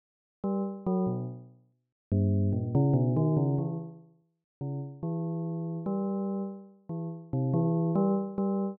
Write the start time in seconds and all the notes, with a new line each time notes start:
0.44 G3
0.86 F#3
1.07 B2
2.12 G2
2.53 A#2
2.75 C#3
2.94 B2
3.16 D#3
3.37 C#3
3.58 E3
4.61 C#3
5.03 E3
5.86 G3
6.89 E3
7.33 C3
7.53 E3
7.95 G3
8.38 G3